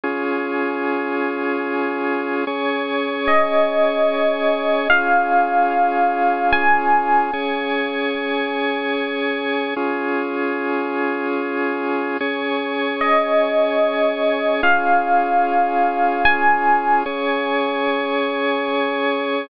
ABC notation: X:1
M:3/4
L:1/8
Q:1/4=74
K:Db
V:1 name="Electric Piano 1"
z6 | z2 e4 | f4 a2 | z6 |
z6 | z2 e4 | f4 a2 | z6 |]
V:2 name="Drawbar Organ"
[DFA]6 | [DAd]6 | [DFA]6 | [DAd]6 |
[DFA]6 | [DAd]6 | [DFA]6 | [DAd]6 |]